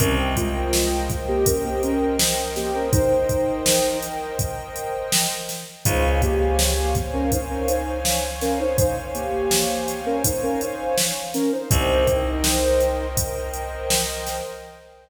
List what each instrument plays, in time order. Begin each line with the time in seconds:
0.00 electric bass (finger) C2, ocarina C#4 A#4, pad 2 (warm) A#4 C5 D#5 G5, kick, closed hi-hat
0.36 ocarina G#3 F4, kick, closed hi-hat
0.73 snare
1.10 kick, closed hi-hat
1.28 ocarina A#3 G4
1.46 ocarina C#4 A#4, kick, closed hi-hat
1.65 ocarina A#3 G4
1.83 ocarina C#4 A#4, closed hi-hat
2.19 snare
2.56 ocarina A#3 G4, snare, closed hi-hat
2.75 ocarina C#4 A#4
2.93 ocarina D#4 C5, kick, closed hi-hat
3.29 kick, closed hi-hat
3.66 snare
4.03 closed hi-hat
4.39 kick, closed hi-hat
4.76 closed hi-hat
5.12 snare
5.49 snare, closed hi-hat
5.85 electric bass (finger) C#2, ocarina D#4 C5, pad 2 (warm) C5 C#5 F5 G#5, kick, closed hi-hat
6.22 ocarina A#3 G4, kick, closed hi-hat
6.59 snare
6.95 kick, closed hi-hat
7.13 ocarina C#4 A#4
7.32 ocarina D#4 C5, kick, closed hi-hat
7.50 ocarina C#4 A#4
7.68 ocarina D#4 C5, closed hi-hat
8.05 snare
8.41 ocarina C#4 A#4, snare, closed hi-hat
8.60 ocarina D#4 C5
8.78 ocarina D#4 C5, kick, closed hi-hat
9.14 ocarina A#3 G4, closed hi-hat
9.51 snare
9.88 closed hi-hat
10.06 ocarina C#4 A#4
10.24 ocarina D#4 C5, kick, closed hi-hat
10.43 ocarina C#4 A#4
10.61 ocarina D#4 C5, closed hi-hat
10.98 snare
11.34 ocarina C#4 A#4, snare, closed hi-hat
11.52 ocarina D#4 C5
11.71 electric bass (finger) C2, ocarina D#4 C5, pad 2 (warm) A#4 C5 D#5 G5, kick, closed hi-hat
12.07 kick, closed hi-hat
12.44 snare
12.80 closed hi-hat
13.17 kick, closed hi-hat
13.54 closed hi-hat
13.90 snare
14.27 snare, closed hi-hat